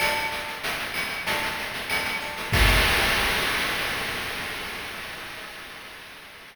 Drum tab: CC |----------------|x---------------|
SH |xxxxxxxxxxxxxxxx|----------------|
CB |x-------x---x-x-|----------------|
CL |x-----x-----x---|----------------|
SD |------o---------|----------------|
BD |----------------|o---------------|